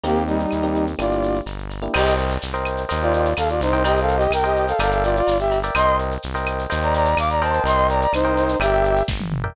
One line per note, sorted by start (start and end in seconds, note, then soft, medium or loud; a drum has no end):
0.03 0.46 D#2 medium
0.03 0.23 A#3 medium
0.03 0.42 A#3 medium
0.03 0.42 C4 loud
0.03 0.42 D#4 medium
0.03 0.23 G4 medium
0.03 0.42 G4 loud
0.03 cowbell medium
0.03 shaker loud
0.15 shaker medium
0.27 0.86 G3 medium
0.27 0.86 D#4 medium
0.27 shaker medium
0.39 shaker medium
0.51 0.95 D#2 medium
0.51 claves medium
0.51 shaker medium
0.63 0.91 A#3 medium
0.63 0.91 C4 medium
0.63 0.91 D#4 medium
0.63 0.91 G4 medium
0.63 shaker medium
0.75 shaker medium
0.87 shaker medium
0.99 1.41 G1 medium
0.99 1.37 A#3 medium
0.99 1.37 D4 loud
0.99 1.37 E4 medium
0.99 1.38 F4 medium
0.99 1.37 G4 loud
0.99 1.38 D5 medium
0.99 cowbell medium
0.99 claves medium
0.99 shaker loud
1.11 shaker medium
1.22 shaker medium
1.34 shaker medium
1.46 1.89 G1 medium
1.46 cowbell medium
1.46 shaker loud
1.58 shaker medium
1.70 cowbell medium
1.70 shaker medium
1.82 1.92 A#3 medium
1.82 1.92 D4 medium
1.82 1.92 E4 medium
1.82 1.92 G4 medium
1.82 shaker medium
1.94 2.38 C2 loud
1.94 2.14 G4 medium
1.94 2.32 A#4 loud
1.94 2.32 C5 loud
1.94 2.32 D#5 loud
1.94 2.14 D#5 medium
1.94 2.32 G5 loud
1.94 crash loud
1.94 cowbell loud
1.94 claves loud
2.06 shaker loud
2.18 shaker medium
2.30 shaker loud
2.42 2.86 C2 medium
2.42 shaker loud
2.54 2.82 A#4 loud
2.54 2.82 C5 loud
2.54 2.82 D#5 loud
2.54 2.82 G5 medium
2.54 shaker medium
2.65 claves loud
2.65 shaker medium
2.77 shaker medium
2.89 3.34 D#2 medium
2.89 3.27 A#4 loud
2.89 3.27 C5 loud
2.89 3.27 D#5 loud
2.89 3.27 G5 loud
2.89 cowbell medium
2.89 shaker loud
3.01 3.12 F4 medium
3.01 3.12 D5 medium
3.01 shaker medium
3.13 3.33 F4 medium
3.13 3.33 D5 medium
3.13 shaker medium
3.25 shaker medium
3.37 3.60 D#2 medium
3.37 3.48 A4 medium
3.37 3.48 F5 medium
3.37 cowbell loud
3.37 claves loud
3.37 shaker loud
3.49 3.60 F4 medium
3.49 3.60 D5 medium
3.49 shaker medium
3.60 4.28 C2 loud
3.60 3.83 D#4 medium
3.60 3.83 C5 medium
3.60 cowbell medium
3.60 shaker loud
3.73 3.82 A#4 loud
3.73 3.82 C5 loud
3.73 3.82 D#5 loud
3.73 3.82 G5 loud
3.73 shaker medium
3.84 4.00 G4 medium
3.84 4.22 A#4 loud
3.84 4.22 C5 loud
3.84 4.22 D#5 loud
3.84 4.00 D#5 medium
3.84 4.22 G5 loud
3.84 cowbell loud
3.84 shaker loud
3.97 shaker medium
4.01 4.16 A4 medium
4.01 4.16 F5 medium
4.08 shaker medium
4.16 4.31 G4 medium
4.16 4.31 D#5 medium
4.16 shaker medium
4.30 4.73 C2 medium
4.30 4.43 A#4 medium
4.30 4.43 G5 medium
4.30 claves loud
4.30 shaker loud
4.44 4.65 G4 medium
4.44 4.72 A#4 loud
4.44 4.72 C5 loud
4.44 4.72 D#5 loud
4.44 4.65 D#5 medium
4.44 4.72 G5 loud
4.44 shaker medium
4.56 shaker medium
4.68 4.79 A4 medium
4.68 4.79 F5 medium
4.68 shaker medium
4.79 5.22 G1 loud
4.79 4.91 A4 medium
4.79 5.18 A#4 loud
4.79 5.18 D5 loud
4.79 5.18 E5 loud
4.79 4.91 F5 medium
4.79 5.18 G5 loud
4.79 cowbell loud
4.79 claves loud
4.79 shaker loud
4.91 5.03 A4 medium
4.91 5.03 F5 medium
4.91 shaker loud
5.04 5.15 F4 medium
5.04 5.15 D5 medium
5.04 shaker loud
5.16 5.37 F4 medium
5.16 5.37 D5 medium
5.16 shaker medium
5.27 5.70 G1 medium
5.27 cowbell loud
5.27 shaker loud
5.39 5.59 G4 medium
5.39 5.59 E5 medium
5.39 shaker medium
5.51 cowbell loud
5.51 shaker medium
5.63 5.73 A#4 loud
5.63 5.73 D5 loud
5.63 5.73 E5 medium
5.63 5.73 G5 medium
5.63 shaker loud
5.75 6.18 C2 medium
5.75 6.13 A#4 loud
5.75 6.13 C5 loud
5.75 5.96 D#5 medium
5.75 6.13 D#5 loud
5.75 6.13 G5 loud
5.75 5.96 C6 loud
5.75 cowbell loud
5.75 claves loud
5.75 shaker loud
5.87 shaker medium
5.99 shaker medium
6.11 shaker medium
6.22 6.67 C2 medium
6.22 shaker loud
6.35 6.63 A#4 loud
6.35 6.63 C5 loud
6.35 6.63 D#5 loud
6.35 6.63 G5 loud
6.35 shaker medium
6.46 claves loud
6.46 shaker loud
6.59 shaker medium
6.70 7.15 D#2 loud
6.70 7.08 A#4 loud
6.70 7.08 C5 loud
6.70 7.08 D#5 loud
6.70 7.08 G5 loud
6.70 cowbell medium
6.70 shaker loud
6.82 6.94 D5 medium
6.82 6.94 A#5 medium
6.82 shaker medium
6.94 7.17 D5 medium
6.94 7.17 A#5 medium
6.94 shaker loud
7.05 shaker loud
7.17 7.60 D#2 medium
7.17 7.29 F5 medium
7.17 7.29 D6 medium
7.17 cowbell medium
7.17 claves loud
7.17 shaker loud
7.30 7.41 D5 medium
7.30 7.41 A#5 medium
7.30 shaker medium
7.42 8.04 A#4 loud
7.42 7.63 C5 medium
7.42 8.04 C5 loud
7.42 8.04 D#5 loud
7.42 8.04 G5 loud
7.42 7.63 A5 medium
7.42 cowbell loud
7.42 shaker medium
7.53 shaker medium
7.64 8.07 C2 loud
7.64 7.87 D#5 medium
7.64 7.87 C6 medium
7.64 cowbell loud
7.64 shaker loud
7.77 shaker medium
7.89 8.00 D5 medium
7.89 8.00 A#5 medium
7.89 shaker medium
8.01 8.12 D5 medium
8.01 8.12 A#5 medium
8.01 shaker medium
8.13 8.56 C2 medium
8.13 8.57 D#4 medium
8.13 8.57 C5 medium
8.13 claves loud
8.13 shaker loud
8.25 8.53 A#4 loud
8.25 8.53 C5 loud
8.25 8.53 D#5 loud
8.25 8.53 G5 loud
8.25 shaker medium
8.37 shaker loud
8.49 shaker loud
8.60 9.02 G1 loud
8.60 9.02 G4 medium
8.60 8.99 A#4 loud
8.60 8.99 D5 loud
8.60 8.99 E5 loud
8.60 9.02 E5 medium
8.60 8.99 G5 loud
8.60 cowbell loud
8.60 claves loud
8.60 shaker loud
8.73 shaker medium
8.84 shaker medium
8.96 shaker medium
9.08 9.51 G1 medium
9.08 kick loud
9.08 snare loud
9.20 high tom loud
9.32 mid tom loud
9.44 9.53 A#4 loud
9.44 9.53 D5 loud
9.44 9.53 E5 loud
9.44 9.53 G5 loud
9.44 floor tom loud